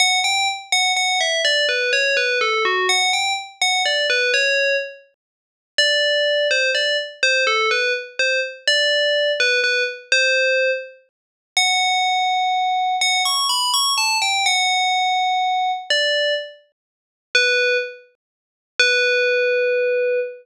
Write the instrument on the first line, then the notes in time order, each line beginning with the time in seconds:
tubular bells
0.00 F#5
0.24 G5
0.72 F#5
0.96 F#5
1.21 E5
1.45 D5
1.69 B4
1.93 C#5
2.17 B4
2.41 A4
2.65 F#4
2.89 F#5
3.13 G5
3.62 F#5
3.86 D5
4.10 B4
4.34 C#5
5.78 D5
6.51 C5
6.75 D5
7.23 C5
7.47 A4
7.71 B4
8.19 C5
8.67 D5
9.40 B4
9.64 B4
10.12 C5
11.57 F#5
13.01 F#5
13.25 C#6
13.49 B5
13.74 C#6
13.98 A5
14.22 G5
14.46 F#5
15.90 D5
17.35 B4
18.80 B4